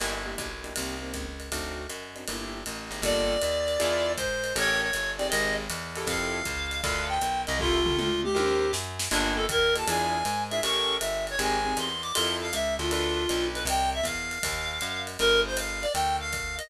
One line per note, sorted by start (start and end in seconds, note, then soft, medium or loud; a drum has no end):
0.00 0.36 G1 medium
0.00 0.19 A#3 medium
0.00 0.19 D4 medium
0.00 0.19 E4 medium
0.00 0.19 G4 medium
0.00 crash medium
0.00 ride medium
0.26 0.48 A#3 medium
0.26 0.48 D4 medium
0.26 0.48 E4 medium
0.26 0.48 G4 medium
0.38 0.74 B1 medium
0.38 kick soft
0.38 hi-hat pedal medium
0.38 ride medium
0.64 0.72 A#3 medium
0.64 0.72 D4 medium
0.64 0.72 E4 medium
0.64 0.72 G4 medium
0.64 ride medium
0.76 1.13 C2 loud
0.76 0.95 A#3 medium
0.76 0.95 C4 medium
0.76 0.95 D#4 medium
0.76 0.95 G4 medium
0.76 ride medium
1.02 1.24 A#3 medium
1.02 1.24 C4 medium
1.02 1.24 D#4 medium
1.02 1.24 G4 medium
1.14 1.50 C#2 medium
1.14 kick soft
1.14 hi-hat pedal medium
1.14 ride medium
1.40 ride medium
1.52 1.87 D2 loud
1.52 1.83 C4 medium
1.52 1.83 D4 medium
1.52 1.83 D#4 medium
1.52 1.83 F#4 medium
1.52 kick soft
1.52 ride medium
1.89 2.25 F#2 medium
1.89 hi-hat pedal medium
1.89 ride medium
2.16 2.24 C4 medium
2.16 2.24 D4 medium
2.16 2.24 D#4 medium
2.16 2.24 F#4 medium
2.16 ride soft
2.28 2.64 G1 medium
2.28 2.59 A#3 medium
2.28 2.59 D4 medium
2.28 2.59 E4 medium
2.28 2.59 G4 medium
2.28 ride medium
2.66 2.90 A1 medium
2.66 hi-hat pedal medium
2.66 ride medium
2.91 3.01 G#1 medium
2.91 3.00 A#3 medium
2.91 3.00 D4 medium
2.91 3.00 E4 medium
2.91 3.00 G4 medium
2.91 ride medium
3.02 3.38 G1 loud
3.02 3.34 A#3 loud
3.02 3.34 F4 loud
3.02 3.34 G4 loud
3.02 3.34 A4 loud
3.02 4.13 D5 medium
3.02 kick soft
3.02 ride medium
3.42 3.78 D#2 medium
3.42 hi-hat pedal medium
3.42 ride medium
3.68 ride medium
3.79 4.17 E2 loud
3.79 4.10 D4 loud
3.79 4.10 E4 loud
3.79 4.10 F4 loud
3.79 4.10 G#4 loud
3.79 ride medium
4.16 4.54 G#2 medium
4.16 4.53 C5 medium
4.16 kick medium
4.16 hi-hat pedal medium
4.16 ride medium
4.44 ride medium
4.56 4.91 A1 loud
4.56 4.86 C#4 loud
4.56 4.86 G4 loud
4.56 4.86 A4 loud
4.56 4.86 A#4 loud
4.56 4.81 C#5 loud
4.56 ride medium
4.81 5.11 C#5 medium
4.93 5.30 G1 medium
4.93 hi-hat pedal medium
4.93 ride medium
5.17 5.62 C4 loud
5.17 5.62 D#4 loud
5.17 5.62 G4 loud
5.17 5.62 G#4 medium
5.17 5.27 D5 medium
5.17 ride medium
5.29 5.68 G#1 loud
5.29 5.54 D#5 medium
5.29 ride medium
5.70 6.06 E2 loud
5.70 hi-hat pedal medium
5.70 ride medium
5.96 6.39 E4 loud
5.96 6.39 F4 loud
5.96 6.39 G4 loud
5.96 6.39 A4 loud
5.96 ride medium
6.07 6.42 F2 loud
6.07 6.80 F5 medium
6.07 kick medium
6.07 ride medium
6.45 6.81 C#2 medium
6.45 kick soft
6.45 hi-hat pedal medium
6.45 ride medium
6.71 ride medium
6.81 7.19 D2 loud
6.81 7.14 D4 loud
6.81 7.14 F4 loud
6.81 7.14 A4 loud
6.81 7.14 B4 loud
6.81 7.03 F5 medium
6.81 kick medium
6.81 ride medium
7.08 7.41 G5 medium
7.21 7.46 B1 medium
7.21 hi-hat pedal medium
7.21 ride medium
7.47 7.96 C2 loud
7.47 7.57 D#5 medium
7.47 ride medium
7.59 7.78 E4 loud
7.59 7.78 F4 loud
7.59 7.97 F4 medium
7.59 7.78 G4 loud
7.59 7.78 A4 loud
7.59 kick medium
7.86 8.08 E4 medium
7.86 8.08 F4 medium
7.86 8.08 G4 medium
7.86 8.08 A4 loud
7.86 floor tom medium
7.98 8.34 D2 medium
7.98 8.21 F4 medium
7.98 mid tom medium
8.23 8.71 G4 medium
8.23 mid tom medium
8.35 8.72 D#2 loud
8.35 8.65 D#4 loud
8.35 8.65 G4 loud
8.35 8.65 A#4 loud
8.35 8.65 C5 loud
8.35 high tom medium
8.73 9.09 F#2 loud
8.73 snare medium
8.99 snare medium
9.11 9.47 G1 loud
9.11 9.42 A#3 medium
9.11 9.34 D4 medium
9.11 9.42 F4 loud
9.11 9.42 G4 loud
9.11 9.42 A4 loud
9.11 crash medium
9.11 ride medium
9.36 9.45 A4 medium
9.49 9.84 D#2 medium
9.49 9.74 A#4 medium
9.49 kick medium
9.49 hi-hat pedal medium
9.49 ride medium
9.75 9.84 A#3 loud
9.75 9.84 F4 medium
9.75 9.84 G4 medium
9.75 9.84 A4 medium
9.75 9.88 A5 medium
9.75 ride medium
9.87 10.23 E2 loud
9.87 10.18 D4 loud
9.87 10.18 E4 loud
9.87 10.18 F4 loud
9.87 10.18 G#4 loud
9.87 10.43 G#5 medium
9.87 ride medium
10.25 10.61 G#2 loud
10.25 hi-hat pedal medium
10.25 ride medium
10.50 10.60 D4 medium
10.50 10.60 E4 medium
10.50 10.60 F4 medium
10.50 10.60 G#4 loud
10.50 10.60 E5 medium
10.50 ride medium
10.63 10.99 A1 loud
10.63 10.95 C#4 loud
10.63 10.95 G4 loud
10.63 10.95 A4 loud
10.63 10.95 A#4 loud
10.63 10.96 C#6 loud
10.63 ride medium
11.00 11.37 G1 medium
11.00 11.25 E5 medium
11.00 hi-hat pedal medium
11.00 ride medium
11.27 11.40 C#5 medium
11.27 ride medium
11.39 11.74 G#1 loud
11.39 11.57 C4 loud
11.39 11.57 D#4 loud
11.39 11.57 G4 loud
11.39 11.57 G#4 loud
11.39 11.77 G#5 medium
11.39 ride medium
11.65 11.87 C4 medium
11.65 11.87 D#4 medium
11.65 11.87 G4 medium
11.65 11.87 G#4 medium
11.77 12.12 E2 medium
11.77 12.02 C6 medium
11.77 hi-hat pedal medium
11.77 ride medium
12.02 12.12 D6 medium
12.02 ride medium
12.14 12.52 F2 loud
12.14 12.46 E4 loud
12.14 12.46 F4 loud
12.14 12.46 G4 loud
12.14 12.46 A4 loud
12.14 12.35 C6 medium
12.14 ride loud
12.41 12.52 F5 medium
12.53 12.78 C#2 medium
12.53 12.74 E5 medium
12.53 hi-hat pedal medium
12.53 ride medium
12.79 13.27 D2 loud
12.79 12.90 F4 medium
12.79 ride medium
12.90 13.22 D4 loud
12.90 13.46 F4 medium
12.90 13.22 F4 loud
12.90 13.22 A4 loud
12.90 13.22 B4 loud
12.90 ride medium
13.29 13.66 B1 loud
13.29 13.60 D4 medium
13.29 13.60 F4 medium
13.29 13.60 A4 medium
13.29 13.60 B4 loud
13.29 hi-hat pedal medium
13.29 ride medium
13.54 13.64 B4 medium
13.54 ride medium
13.65 14.01 C2 loud
13.65 13.90 G5 medium
13.65 ride loud
13.94 14.05 E5 medium
14.03 14.39 E2 medium
14.03 15.02 F5 medium
14.03 kick soft
14.03 hi-hat pedal medium
14.03 ride medium
14.31 ride medium
14.43 14.80 D#2 loud
14.43 kick medium
14.43 ride loud
14.81 15.17 F#2 medium
14.81 hi-hat pedal medium
14.81 ride medium
15.07 ride medium
15.19 15.86 G1 loud
15.19 15.41 A#4 medium
15.19 ride medium
15.46 15.56 C5 medium
15.57 15.83 F5 medium
15.57 hi-hat pedal medium
15.57 ride medium
15.82 15.92 D5 medium
15.82 ride medium
15.94 16.61 D2 loud
15.94 16.16 G5 medium
15.94 ride medium
16.20 16.55 F5 medium
16.33 kick medium
16.33 hi-hat pedal medium
16.33 ride medium
16.58 16.68 D#5 medium
16.58 ride medium